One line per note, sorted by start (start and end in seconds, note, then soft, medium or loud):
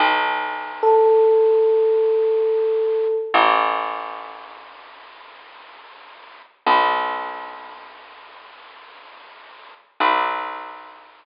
0.00 3.06 B1 loud
0.83 3.15 A4 medium
3.34 6.41 A1 loud
6.66 9.73 B1 loud
10.00 11.25 B1 loud